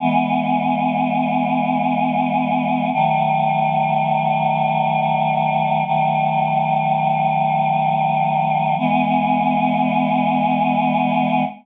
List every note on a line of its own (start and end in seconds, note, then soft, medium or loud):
0.00 2.90 E3 medium
0.00 2.90 G#3 medium
0.00 2.90 B3 medium
2.93 5.82 D#3 medium
2.93 5.82 F#3 medium
2.93 5.82 A3 medium
5.85 8.75 D#3 medium
5.85 8.75 F#3 medium
5.85 8.75 A3 medium
8.78 11.43 E3 loud
8.78 11.43 G#3 loud
8.78 11.43 B3 loud